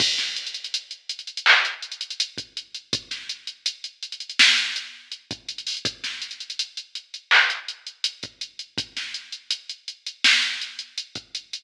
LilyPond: \new DrumStaff \drummode { \time 4/4 \tempo 4 = 82 <cymc bd>16 <hh sn>16 hh32 hh32 hh32 hh32 hh16 hh16 hh32 hh32 hh32 hh32 hc16 hh16 hh32 hh32 hh32 hh32 hh16 <hh bd>16 hh16 hh16 | <hh bd>16 <hh sn>16 hh16 hh16 hh16 hh16 hh32 hh32 hh32 hh32 sn16 hh16 hh8 hh16 <hh bd>16 hh32 hh32 hho32 hh32 | <hh bd>16 <hh sn>16 hh32 hh32 hh32 hh32 hh16 hh16 hh16 hh16 hc16 hh16 hh16 hh16 hh16 <hh bd>16 hh16 hh16 | <hh bd>16 <hh sn>16 hh16 hh16 hh16 hh16 hh16 hh16 sn16 hh16 hh16 hh16 hh16 <hh bd>16 hh16 hh16 | }